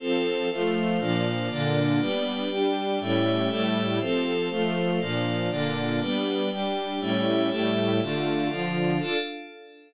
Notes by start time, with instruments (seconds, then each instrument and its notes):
0.00 string ensemble 1 F3 C4 A4, pad 5 (bowed) F4 A4 C5
0.51 string ensemble 1 F3 A3 A4, pad 5 (bowed) F4 C5 F5
0.99 string ensemble 1 A#2 F3 D4, pad 5 (bowed) A#3 F4 D5
1.50 string ensemble 1 A#2 D3 D4, pad 5 (bowed) A#3 D4 D5
1.99 string ensemble 1 G3 B3 D4, pad 5 (bowed) G4 B4 D5
2.49 string ensemble 1 G3 D4 G4, pad 5 (bowed) G4 D5 G5
3.00 string ensemble 1 A2 G3 C#4 E4, pad 5 (bowed) A3 G4 C#5 E5
3.49 string ensemble 1 A2 G3 A3 E4, pad 5 (bowed) A3 G4 A4 E5
3.99 string ensemble 1 F3 C4 A4, pad 5 (bowed) F4 A4 C5
4.50 string ensemble 1 F3 A3 A4, pad 5 (bowed) F4 C5 F5
5.00 string ensemble 1 A#2 F3 D4, pad 5 (bowed) A#3 F4 D5
5.50 string ensemble 1 A#2 D3 D4, pad 5 (bowed) A#3 D4 D5
6.00 string ensemble 1 G3 B3 D4, pad 5 (bowed) G4 B4 D5
6.50 string ensemble 1 G3 D4 G4, pad 5 (bowed) G4 D5 G5
7.00 string ensemble 1 A2 G3 C#4 E4, pad 5 (bowed) A3 G4 C#5 E5
7.49 string ensemble 1 A2 G3 A3 E4, pad 5 (bowed) A3 G4 A4 E5
8.01 string ensemble 1 D3 A3 F4, pad 5 (bowed) D4 A4 F5
8.49 string ensemble 1 D3 F3 F4, pad 5 (bowed) D4 F4 F5
8.99 string ensemble 1 D4 F4 A4, pad 5 (bowed) D4 A4 F5